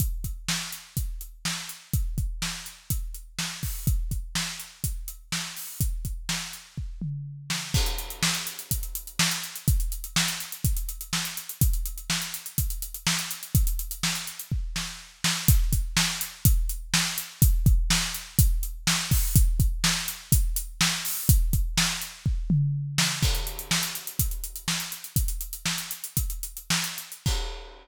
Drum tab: CC |----------------|----------------|----------------|----------------|
HH |x-x---x-x-x---x-|x-x---x-x-x---o-|x-x---x-x-x---o-|x-x---x---------|
SD |----o-------o---|----o-------o---|----o-------o---|----o---------o-|
T2 |----------------|----------------|----------------|----------o-----|
BD |o-o-----o-------|o-o-----o-----o-|o-o-----o-------|o-o-----o-------|

CC |x---------------|----------------|----------------|----------------|
HH |-xxx-xxxxxxx-xxx|xxxx-xxxxxxx-xxx|xxxx-xxxxxxx-xxx|xxxx-xxx--------|
SD |----o-------o---|----o-------o---|----o-------o---|----o-----o---o-|
T2 |----------------|----------------|----------------|----------------|
BD |o-------o-------|o-------o-------|o-------o-------|o-------o-------|

CC |----------------|----------------|----------------|----------------|
HH |x-x---x-x-x---x-|x-x---x-x-x---o-|x-x---x-x-x---o-|x-x---x---------|
SD |----o-------o---|----o-------o---|----o-------o---|----o---------o-|
T2 |----------------|----------------|----------------|----------o-----|
BD |o-o-----o-------|o-o-----o-----o-|o-o-----o-------|o-o-----o-------|

CC |x---------------|----------------|x---------------|
HH |-xxx-xxxxxxx-xxx|xxxx-xxxxxxx-xxx|----------------|
SD |----o-------o---|----o-------o---|----------------|
T2 |----------------|----------------|----------------|
BD |o-------o-------|o-------o-------|o---------------|